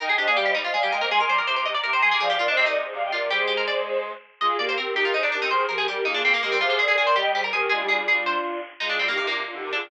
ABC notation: X:1
M:6/8
L:1/16
Q:3/8=109
K:Cm
V:1 name="Violin"
[eg] [eg] [ce] [df] [df] [ce] z [ce] [df] [fa] [eg] [ce] | [ac'] [ac'] [bd'] [bd'] [bd'] [bd'] z [bd'] [bd'] [gb] [ac'] [bd'] | [df] [df] [Bd] [ce] [ce] [Bd] z [Ac] [df] [eg] [Bd] [Bd] | [Ac]8 z4 |
[K:Eb] [FA]2 [GB] [GB] [GB]2 [GB]2 [Ac] z [GB]2 | [Ac]2 [GB] [GB] [GB]2 [FA]2 [FA] z [GB]2 | [Ac]2 [Bd] [Bd] [Bd]2 [eg]2 [Ac] z [GB]2 | [DF] [EG] [DF] [FA] [DF] [DF]5 z2 |
[K:Cm] [FA] [FA] [DF] [EG] [EG] [DF] z [DF] [EG] [GB] [FA] [DF] |]
V:2 name="Harpsichord"
B A G A G G E F A G B B | A B c B c c e d B c A A | A G F D C E5 F2 | G2 G B d4 z4 |
[K:Eb] e2 d c B2 G F E D D E | c2 B A G2 E D C B, B, C | F F A A A c G2 G B A2 | A2 A2 A2 c4 z2 |
[K:Cm] E D C B, B, B,5 D2 |]
V:3 name="Clarinet"
E2 D B, G,2 G, z A, G, A, B, | A,2 G, E, C,2 C, z C, C, F, C, | F,2 E, C, C,2 C, z C, C, C, C, | G, A,9 z2 |
[K:Eb] A,2 B,2 C2 E E E E D C | E,2 F,2 G,2 B, B, B, B, A, G, | C,2 D,2 E,2 G, G, G, G, F, E, | A, G,7 z4 |
[K:Cm] A,2 G, E, C,2 C, z D, C, D, E, |]